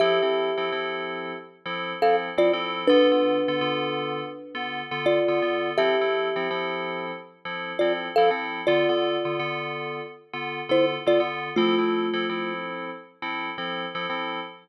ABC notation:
X:1
M:4/4
L:1/16
Q:"Swing 16ths" 1/4=83
K:F
V:1 name="Kalimba"
[Ge]8 z3 [Af] z [Fd] z2 | [D=B]12 [Fd]4 | [Ge]8 z3 [Fd] z [Af] z2 | [Fd]8 z3 [Ec] z [Fd] z2 |
[A,F]6 z10 |]
V:2 name="Electric Piano 2"
[F,CEA] [F,CEA]2 [F,CEA] [F,CEA]5 [F,CEA]2 [F,CEA]2 [F,CEA] [F,CEA]2 | [D,=B,FA] [D,B,FA]2 [D,B,FA] [D,B,FA]5 [D,B,FA]2 [D,B,FA]2 [D,B,FA] [D,B,FA]2 | [F,CEA] [F,CEA]2 [F,CEA] [F,CEA]5 [F,CEA]2 [F,CEA]2 [F,CEA] [F,CEA]2 | [D,=B,FA] [D,B,FA]2 [D,B,FA] [D,B,FA]5 [D,B,FA]2 [D,B,FA]2 [D,B,FA] [D,B,FA]2 |
[F,CEA] [F,CEA]2 [F,CEA] [F,CEA]5 [F,CEA]2 [F,CEA]2 [F,CEA] [F,CEA]2 |]